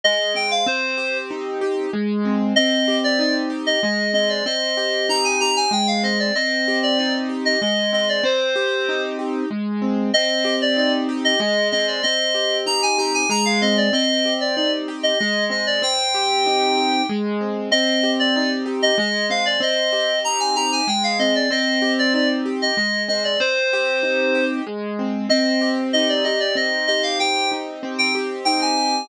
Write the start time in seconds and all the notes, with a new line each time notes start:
0.04 G#3 D#5
0.34 C4 G5
0.51 F5
0.66 C4 C5
0.98 G4
1.31 D#4
1.61 G4
1.93 G#3
2.25 C4
2.56 C4 D#5
2.88 G4
3.04 D5
3.19 D#4 D5
3.50 G4
3.66 D#5
3.83 G#3 D#5
4.14 C4 D#5
4.29 D5
4.46 C4 D#5
4.77 G4
5.09 D#4 A#5
5.24 G#5
5.40 G4 A#5
5.56 G#5
5.71 G#3 G5
5.87 F5
6.03 C4 D#5
6.20 D5
6.35 C4 D#5
6.68 G4
6.83 D5
6.98 D#4 D5
7.29 G4
7.45 D#5
7.61 G#3 D#5
7.93 C4 D#5
8.09 D5
8.24 C4 C5
8.56 G4
8.89 D#4
9.19 G4
9.51 G#3
9.82 C4
10.14 C4 D#5
10.45 G4
10.62 D5
10.77 D#4 D5
11.09 G4
11.25 D#5
11.40 G#3 D#5
11.72 C4 D#5
11.87 D5
12.03 C4 D#5
12.34 G4
12.66 D#4 A#5
12.83 G#5
12.98 G4 A#5
13.14 G#5
13.29 G#3 A#5
13.45 F5
13.62 C4 D#5
13.77 D5
13.93 C4 D#5
14.25 G4
14.41 D5
14.56 D#4 D5
14.88 G4
15.03 D#5
15.19 G#3 D#5
15.50 C4 D#5
15.67 D5
15.82 C4 G5
16.15 G4
16.46 D#4
16.78 G4
17.09 G#3
17.41 C4
17.71 C4 D#5
18.03 G4
18.19 D5
18.36 D#4 D5
18.66 G4
18.83 D#5
18.98 G#3 D#5
19.30 C4 F5
19.46 D5
19.60 C4 D#5
19.93 G4
20.24 D#4 A#5
20.40 G#5
20.56 G4 A#5
20.72 G#5
20.88 G#3 G5
21.04 F5
21.19 C4 D#5
21.35 D5
21.51 C4 D#5
21.82 G4
21.99 D5
22.14 D#4 D5
22.46 G4
22.62 D#5
22.77 G#3 D#5
23.08 C4 D#5
23.24 D5
23.40 C4 C5
23.73 G4
24.03 D#4
24.35 G4
24.67 G#3
24.99 C4
25.29 C4 D#5
25.61 G4
25.93 D#4 D#5
26.09 D5
26.24 G4 D#5
26.40 D5
26.55 C4 D#5
26.87 G4 D#5
27.03 F5
27.19 G4 G5
27.52 D#4
27.83 C4
27.99 G5
28.15 G4
28.45 D#4 G5
28.61 G#5
28.77 G4